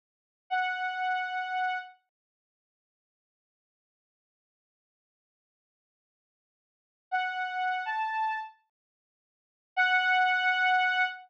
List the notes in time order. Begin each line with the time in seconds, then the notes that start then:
0.50 F#5
7.11 F#5
7.86 A5
9.76 F#5